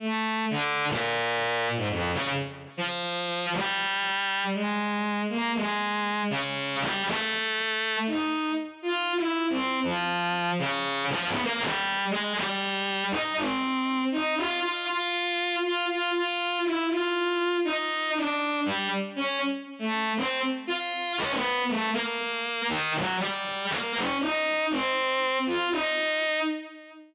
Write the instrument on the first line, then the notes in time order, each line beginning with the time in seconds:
violin
0.00 A3
0.50 D3
0.88 A#2
1.76 G#2
1.89 F2
2.14 C#3
2.77 F3
3.53 G3
4.54 G#3
5.29 A#3
5.55 G#3
6.30 C#3
6.81 G3
7.06 A3
8.07 D#4
8.82 F4
9.16 E4
9.50 C4
9.83 F3
10.59 C#3
11.09 F3
11.26 B3
11.43 A#3
11.60 G3
12.10 G#3
12.35 G3
13.11 D#4
13.36 C4
14.12 D#4
14.37 F4
14.62 F4
14.87 F4
15.63 F4
15.88 F4
16.13 F4
16.64 E4
16.89 F4
17.65 D#4
18.15 D4
18.66 G3
19.16 C#4
19.79 A3
20.17 C4
20.67 F4
21.18 C#4
21.30 B3
21.68 A3
21.93 A#3
22.69 D#3
22.94 F#3
23.19 G3
23.70 A#3
23.95 C#4
24.20 D#4
24.71 C4
25.46 F4
25.71 D#4